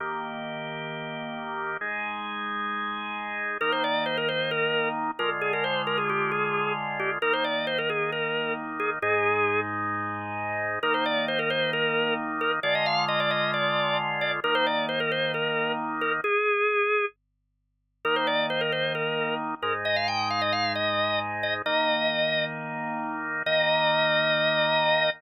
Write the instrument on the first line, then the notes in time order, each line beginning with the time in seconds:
drawbar organ
0.00 D#3 A#3 G4
1.81 G#3 D#4 G#4
3.61 D#3 A#3 D#4 A#4
3.72 C5
3.84 D5
4.06 C5
4.17 A#4
4.28 C5
4.51 A#4
5.19 D3 G#3 F4 A#4
5.41 G#4
5.53 A#4
5.64 C5
5.87 A#4
5.98 G#4
6.09 G4
6.31 G#4
6.99 G4
7.22 D#3 A#3 D#4 A#4
7.33 C5
7.44 D5
7.67 C5
7.78 A#4
7.89 G#4
8.12 A#4
8.79 G#4
9.02 G#2 G#3 D#4 G#4
10.83 D#3 A#3 D#4 A#4
10.94 C5
11.05 D5
11.28 C5
11.39 A#4
11.50 C5
11.73 A#4
12.41 A#4
12.63 D3 G#3 F4 D5
12.75 D#5
12.86 F5
13.08 D#5
13.20 D5
13.31 D#5
13.53 D5
14.21 D5
14.44 D#3 A#3 D#4 A#4
14.55 C5
14.66 D5
14.89 C5
15.00 A#4
15.11 C5
15.34 A#4
16.01 A#4
16.24 G#4
18.05 D#3 A#3 D#4 A#4
18.16 C5
18.27 D5
18.50 C5
18.61 A#4
18.72 C5
18.95 A#4
19.62 G#2 G#3 D#4 A#4
19.85 D#5
19.96 F5
20.08 G5
20.30 F5
20.41 D#5
20.52 F5
20.75 D#5
21.43 D#5
21.66 D#3 A#3 D#4 D#5
23.46 D#3 A#3 D#4 D#5